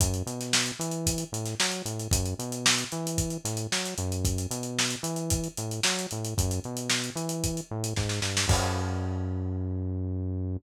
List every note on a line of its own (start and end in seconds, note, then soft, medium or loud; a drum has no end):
0.00 0.23 F#2 loud
0.00 kick loud
0.00 closed hi-hat loud
0.14 closed hi-hat medium
0.26 0.72 B2 medium
0.26 closed hi-hat medium
0.41 snare soft
0.41 closed hi-hat medium
0.53 snare loud
0.66 snare soft
0.66 closed hi-hat medium
0.79 1.24 E3 loud
0.79 closed hi-hat medium
0.91 closed hi-hat medium
1.07 kick medium
1.07 closed hi-hat loud
1.18 closed hi-hat medium
1.32 1.55 A2 medium
1.32 closed hi-hat medium
1.46 snare soft
1.46 closed hi-hat medium
1.60 1.82 F#3 loud
1.60 snare loud
1.71 closed hi-hat medium
1.85 2.08 A2 medium
1.85 closed hi-hat medium
1.99 closed hi-hat medium
2.11 2.34 F#2 loud
2.11 kick loud
2.11 closed hi-hat loud
2.26 closed hi-hat medium
2.39 2.84 B2 loud
2.39 closed hi-hat medium
2.52 closed hi-hat medium
2.66 snare loud
2.78 closed hi-hat medium
2.92 3.37 E3 loud
2.92 closed hi-hat medium
3.07 closed hi-hat medium
3.18 kick medium
3.18 closed hi-hat medium
3.30 closed hi-hat medium
3.44 3.67 A2 loud
3.44 snare soft
3.44 closed hi-hat medium
3.57 closed hi-hat medium
3.72 3.94 F#3 medium
3.72 snare medium
3.86 snare soft
3.86 closed hi-hat medium
3.98 4.47 F#2 loud
3.98 closed hi-hat medium
4.12 closed hi-hat medium
4.25 kick loud
4.25 closed hi-hat medium
4.38 closed hi-hat medium
4.51 4.96 B2 loud
4.51 closed hi-hat medium
4.63 closed hi-hat medium
4.79 snare loud
4.90 closed hi-hat medium
5.03 5.48 E3 loud
5.03 closed hi-hat medium
5.16 closed hi-hat medium
5.30 kick medium
5.30 closed hi-hat loud
5.44 closed hi-hat medium
5.57 5.80 A2 medium
5.57 closed hi-hat medium
5.71 closed hi-hat medium
5.83 6.07 F#3 loud
5.83 snare loud
5.99 closed hi-hat medium
6.11 6.34 A2 medium
6.11 closed hi-hat medium
6.25 closed hi-hat medium
6.37 6.60 F#2 loud
6.37 kick medium
6.37 closed hi-hat medium
6.51 closed hi-hat medium
6.64 7.10 B2 medium
6.64 closed hi-hat soft
6.77 closed hi-hat medium
6.90 snare loud
7.04 closed hi-hat medium
7.15 7.61 E3 loud
7.15 closed hi-hat medium
7.29 closed hi-hat medium
7.44 kick medium
7.44 closed hi-hat medium
7.57 closed hi-hat medium
7.71 7.94 A2 loud
7.84 closed hi-hat medium
7.96 8.20 G#2 loud
7.96 kick medium
7.96 snare medium
8.09 snare medium
8.22 8.46 G2 medium
8.22 snare medium
8.37 snare loud
8.48 10.57 F#2 loud
8.48 kick loud
8.48 crash loud